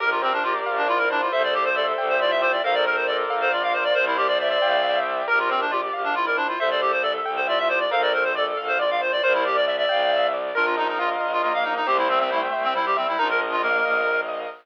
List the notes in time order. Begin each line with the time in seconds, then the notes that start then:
0.00 A#1 G4 A#4
0.11 F4
0.22 C4 C5
0.33 D4
0.43 F4 G4 D5
0.65 A#1 F5
0.77 D4
0.88 E4 F4 D5
0.98 A#4
1.10 D4 C5
1.21 F4
1.31 C2 A4 C5 E5
1.44 D5
1.54 G4 D5
1.65 C5
1.75 A4 D5 E5
1.98 C2 G5
2.09 C5
2.19 F4 D5 E5
2.31 E5
2.41 C5 D5
2.52 D5
2.63 A#1 A4 A#4 C5 F5
2.74 D5
2.85 A#4 C5
2.96 C5
3.07 A4 D5
3.30 A#1 F5
3.41 C5
3.52 F4 D5
3.63 F5
3.73 C5
3.84 D5
3.94 C2 A#4 C5 D5
4.07 E4
4.17 G4 D5
4.28 D5
4.39 D5 E5
4.50 D5
4.61 C2 F5 G5
4.83 E5
5.05 D5
5.28 A#1 G4 A#4
5.39 F4
5.49 C4 C5
5.61 D4
5.71 F4 G4 D5
5.93 A#1 F5
6.04 D4
6.15 E4 F4 D5
6.26 A#4
6.37 D4 C5
6.48 F4
6.59 C2 A4 C5 E5
6.71 D5
6.81 G4 D5
6.92 C5
7.02 A4 D5 E5
7.25 C2 G5
7.36 C5
7.47 F4 D5 E5
7.58 E5
7.69 C5 D5
7.80 D5
7.91 A#1 A4 A#4 C5 F5
8.02 D5
8.13 A#4 C5
8.24 C5
8.35 A4 D5
8.57 A#1 F5
8.68 C5
8.79 F4 D5
8.91 F5
9.01 C5
9.12 D5
9.23 C2 A#4 C5 D5
9.34 E4
9.45 G4 D5
9.56 D5
9.66 D5 E5
9.78 D5
9.89 C2 F5 G5
10.11 E5
10.33 D5
10.55 A#1 D4 F4 A#4
10.65 F4
10.77 D#4 D#5
10.88 D#4
10.99 F4 F5
11.20 A#1 D#5
11.33 F4
11.42 A#3 F4 A#4
11.54 F5
11.64 D#4 D#5
11.76 D#4
11.86 C2 A3 C4 G4 C5
11.98 E4
12.09 C4 E5
12.20 C4
12.30 A3 E4 G5
12.52 C2 E5
12.64 C4
12.74 G3 E4 C5
12.86 G4
12.97 C4 E5
13.08 E4
13.18 A#1 D4 D#4 F4 A#4
13.30 A#4
13.41 D#5
13.52 F4
13.62 A#3 A#4 F5
13.84 A#1 D#5
14.07 A#4
14.28 D#5